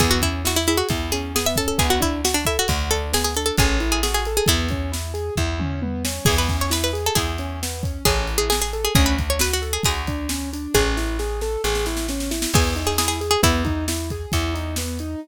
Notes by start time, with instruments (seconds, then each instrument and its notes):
0.00 electric bass (finger) E2, acoustic grand piano B3, pizzicato strings G#4, kick, closed hi-hat
0.11 pizzicato strings F#4
0.22 acoustic grand piano C#4, pizzicato strings E4, kick, closed hi-hat
0.45 acoustic grand piano E4, pizzicato strings F#4, snare
0.56 pizzicato strings E4
0.67 pizzicato strings E4, acoustic grand piano G#4, closed hi-hat
0.77 pizzicato strings F#4
0.89 electric bass (finger) E2, acoustic grand piano E4, kick, closed hi-hat
1.12 acoustic grand piano C#4, pizzicato strings G#4, closed hi-hat
1.35 acoustic grand piano B3, pizzicato strings G#4, snare
1.46 pizzicato strings E5
1.56 acoustic grand piano C#4, pizzicato strings A4, kick, closed hi-hat
1.68 pizzicato strings A4
1.78 electric bass (finger) D2, acoustic grand piano B3, pizzicato strings G#4, kick, closed hi-hat
1.90 pizzicato strings F#4
2.00 acoustic grand piano D4, pizzicato strings E4, kick, closed hi-hat
2.25 acoustic grand piano F#4, pizzicato strings F#4, snare
2.34 pizzicato strings D4
2.45 pizzicato strings E4, acoustic grand piano A4, kick, closed hi-hat
2.59 pizzicato strings F#4
2.68 electric bass (finger) D2, acoustic grand piano F#4, kick, closed hi-hat
2.91 acoustic grand piano D4, pizzicato strings A4, closed hi-hat
3.13 acoustic grand piano B3, pizzicato strings G#4, snare
3.24 pizzicato strings G#4
3.35 acoustic grand piano D4, pizzicato strings A4, closed hi-hat
3.46 pizzicato strings A4
3.57 electric bass (finger) A1, acoustic grand piano C#4, pizzicato strings G#4, kick, closed hi-hat
3.80 acoustic grand piano E4, closed hi-hat
3.92 pizzicato strings G#4
4.03 acoustic grand piano F#4, pizzicato strings G#4, snare
4.14 pizzicato strings G#4
4.25 acoustic grand piano A4, closed hi-hat
4.37 pizzicato strings G#4
4.46 electric bass (finger) E2, acoustic grand piano B3, pizzicato strings E4, kick, closed hi-hat
4.68 acoustic grand piano C#4, kick, closed hi-hat
4.92 acoustic grand piano E4, snare
5.14 acoustic grand piano G#4, closed hi-hat
5.36 electric bass (finger) E2, acoustic grand piano E4, kick, floor tom
5.60 acoustic grand piano C#4, mid tom
5.82 acoustic grand piano B3, high tom
6.05 acoustic grand piano C#4, snare
6.25 electric bass (finger) E2, acoustic grand piano B3, pizzicato strings G#4, kick, crash
6.38 pizzicato strings B4
6.49 acoustic grand piano C#4, kick, closed hi-hat
6.61 pizzicato strings C#5
6.70 acoustic grand piano E4, pizzicato strings B4, snare
6.84 pizzicato strings B4
6.93 acoustic grand piano G#4, closed hi-hat
7.06 pizzicato strings A4
7.15 electric bass (finger) E2, acoustic grand piano E4, pizzicato strings G#4, kick, closed hi-hat
7.38 acoustic grand piano C#4, closed hi-hat
7.62 acoustic grand piano B3, snare
7.83 acoustic grand piano C#4, kick, closed hi-hat
8.05 electric bass (finger) A1, acoustic grand piano C#4, pizzicato strings G#4, kick, closed hi-hat
8.27 acoustic grand piano E4, closed hi-hat
8.38 pizzicato strings G#4
8.50 pizzicato strings G#4, acoustic grand piano G#4, snare
8.62 pizzicato strings G#4
8.73 acoustic grand piano A4, closed hi-hat
8.85 pizzicato strings G#4
8.95 electric bass (finger) D2, acoustic grand piano C#4, pizzicato strings G#4, kick, closed hi-hat
9.06 pizzicato strings B4
9.18 acoustic grand piano D4, kick, closed hi-hat
9.30 pizzicato strings C#5
9.39 acoustic grand piano F#4, pizzicato strings B4, snare
9.53 pizzicato strings F#4
9.62 acoustic grand piano A4, closed hi-hat
9.73 pizzicato strings G#4
9.83 electric bass (finger) D2, acoustic grand piano F#4, pizzicato strings G#4, kick, closed hi-hat
10.07 acoustic grand piano D4, kick, closed hi-hat
10.29 acoustic grand piano C#4, snare
10.53 acoustic grand piano D4, closed hi-hat
10.74 electric bass (finger) A1, acoustic grand piano C#4, pizzicato strings G#4, kick, snare
10.97 acoustic grand piano E4, snare
11.19 acoustic grand piano G#4, snare
11.41 acoustic grand piano A4, snare
11.64 electric bass (finger) A1, acoustic grand piano G#4, snare
11.75 snare
11.86 acoustic grand piano E4, snare
11.97 snare
12.08 acoustic grand piano C#4, snare
12.20 snare
12.31 acoustic grand piano E4, snare
12.42 snare
12.53 electric bass (finger) E2, acoustic grand piano B3, pizzicato strings G#4, kick, crash
12.76 acoustic grand piano D#4, closed hi-hat
12.87 pizzicato strings G#4
12.98 acoustic grand piano E4, pizzicato strings G#4, snare
13.08 pizzicato strings G#4
13.21 acoustic grand piano G#4, closed hi-hat
13.31 pizzicato strings G#4
13.43 electric bass (finger) E2, acoustic grand piano B3, pizzicato strings E4, kick, closed hi-hat
13.65 acoustic grand piano D#4, kick, closed hi-hat
13.88 acoustic grand piano E4, snare
14.10 acoustic grand piano G#4, kick, closed hi-hat
14.32 electric bass (finger) E2, acoustic grand piano E4, kick, closed hi-hat
14.54 acoustic grand piano D#4, closed hi-hat
14.76 acoustic grand piano B3, snare
14.99 acoustic grand piano D#4, closed hi-hat